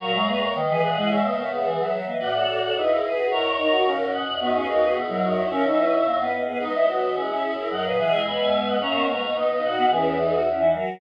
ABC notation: X:1
M:2/2
L:1/8
Q:1/2=109
K:B
V:1 name="Choir Aahs"
[ac']2 [ac']2 [Bd]2 [df]2 | [ce] [Bd] [Ac] [GB]3 z2 | [=df]2 [df]2 [EG]2 [GB]2 | [ac']2 [ac']2 [Ac]2 [df]2 |
[DF]2 [DF]2 [EG]2 [DF]2 | [ce]5 z3 | [Bd]2 [Bd]2 [EG]2 [EG]2 | [df] [Bd] [df] [eg] [gb] [eg] [eg] [df] |
[ac']2 [ac']2 [Bd]2 [df]2 | [GB]4 z4 |]
V:2 name="Choir Aahs"
[FA] [Ac] [GB] [Ac] z [GB] [GB] [EG] | [ce] [ce] [ce] [ce] z [ce] [ce] [Bd] | [B=d] [=Ac]2 [Ac] [B^d] [^Ac] [GB]2 | [Ac]6 z2 |
[Bd] [GB] [Ac] [GB] z [Ac] [Ac] [ce] | [Ac] [ce] [Bd] [ce] z [Bd] [Bd] [GB] | [Bd] [ce] [ce] [ce] z [ce] [ce] [Ac] | [Ac] [GB] [EG]2 [G,B,]4 |
[A,C]2 [G,B,] [B,D] [B,D] [B,D] [DF]2 | [CE]2 [B,D] [DF] [CE] [DF] [FA]2 |]
V:3 name="Choir Aahs"
F, G, A,2 D, E,2 G, | G, A, B,2 E, F,2 A, | F F F2 D E2 F | E z D F C3 z |
B, C D2 B, F,2 E | C D E2 A, B,2 B, | D E F2 C C2 E | F,2 E, G,3 z2 |
C B, A,2 D D2 B, | E,2 E, z2 E, F,2 |]
V:4 name="Choir Aahs" clef=bass
A,, F,, E,,2 D, B,, A,, G,, | B,, C,3 E, F, F, E, | =A,,2 A,,2 D,,2 z2 | G,, E,, D,,2 C, G,, B,, E,, |
F,, D,, D,,2 B,, G,, F,, E,, | C, B,,3 F,, F,, F,, G,, | G, G, F, E, G, z3 | F,, A,, B,,2 D,, E,, F,, G,, |
F,, G,,3 B,, C, A,, G,, | E,,7 z |]